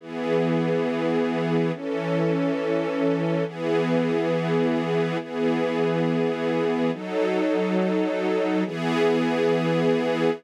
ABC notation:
X:1
M:3/4
L:1/8
Q:1/4=104
K:E
V:1 name="String Ensemble 1"
[E,B,G]6 | [E,CA]6 | [E,B,G]6 | [E,B,G]6 |
[F,DA]6 | [E,B,G]6 |]